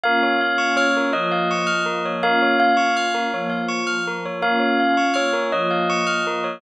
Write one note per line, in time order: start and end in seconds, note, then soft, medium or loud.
0.04 1.12 A#3 medium
0.04 1.12 C#4 medium
0.04 1.12 F4 medium
0.04 0.21 A#4 loud
0.04 0.72 F5 loud
0.23 0.39 C#5 medium
0.41 0.57 F5 medium
0.58 0.74 C#6 medium
0.77 1.11 C#5 medium
0.77 0.94 F6 medium
0.97 1.13 A#4 medium
1.13 2.22 F3 medium
1.13 2.22 A#3 medium
1.13 2.22 F4 medium
1.13 1.29 C#5 medium
1.13 2.09 D#5 medium
1.32 1.48 F5 medium
1.51 1.67 C#6 medium
1.67 1.83 F6 medium
1.86 2.02 A#4 medium
2.05 2.22 C#5 medium
2.23 3.32 A#3 medium
2.23 3.32 C#4 medium
2.23 3.32 F4 medium
2.23 2.40 A#4 loud
2.23 2.56 F5 loud
2.42 2.59 C#5 medium
2.60 3.26 F5 medium
2.60 2.76 F5 medium
2.77 2.93 C#6 medium
2.97 3.13 F6 medium
3.14 3.31 A#4 medium
3.33 4.41 F3 medium
3.33 4.41 A#3 medium
3.33 4.41 F4 medium
3.33 3.50 C#5 medium
3.50 3.66 F5 medium
3.68 3.85 C#6 medium
3.87 4.03 F6 medium
4.07 4.24 A#4 medium
4.25 4.42 C#5 medium
4.42 5.51 A#3 medium
4.42 5.51 C#4 medium
4.42 5.51 F4 medium
4.42 4.59 A#4 loud
4.42 5.04 F5 medium
4.60 4.76 C#5 medium
4.80 4.96 F5 medium
4.97 5.14 C#6 medium
5.14 5.49 C#5 medium
5.14 5.30 F6 medium
5.33 5.50 A#4 medium
5.52 6.61 F3 medium
5.52 6.61 A#3 medium
5.52 6.61 F4 medium
5.52 5.70 C#5 medium
5.52 6.54 D#5 medium
5.71 5.87 F5 medium
5.90 6.06 C#6 loud
6.07 6.23 F6 medium
6.27 6.43 A#4 medium
6.44 6.60 C#5 medium